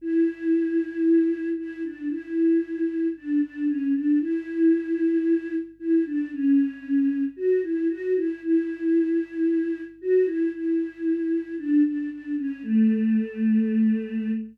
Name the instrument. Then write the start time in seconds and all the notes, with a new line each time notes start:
choir aahs
0.01 E4
1.58 E4
1.84 D4
2.10 E4
3.16 D4
3.42 D4
3.67 C#4
3.95 D4
4.21 E4
5.79 E4
6.06 D4
6.33 C#4
7.36 F#4
7.63 E4
7.89 F#4
8.16 E4
8.43 E4
10.01 F#4
10.26 E4
10.54 E4
11.58 D4
11.85 D4
12.11 D4
12.38 C#4
12.63 A3